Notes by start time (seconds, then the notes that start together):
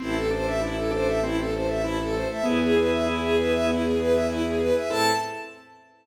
0.00 A1 C4 E4 C5 E5 A5
0.15 A4
0.31 D4 A4 C5
0.46 E5
0.61 E4
0.77 A4
0.91 D4 A4 C5
1.07 E5
1.22 C4 E4
1.38 A4
1.53 A4 C5
1.68 E5
1.83 E4
1.99 A4
2.13 A3 A4 C5
2.30 E5
2.44 E2 B3 E4 G#4 B4 E5 G#5
2.61 G#4
2.76 G#4 B4
2.90 E5
3.06 E4
3.22 G#4
3.36 G#4 B4
3.52 E5
3.67 B3 E4
3.83 G#4
3.97 G#4 B4
4.13 E5
4.28 E4
4.44 G#4
4.59 G#4 B4
4.75 E5
4.89 A2 C4 E4 A4 A5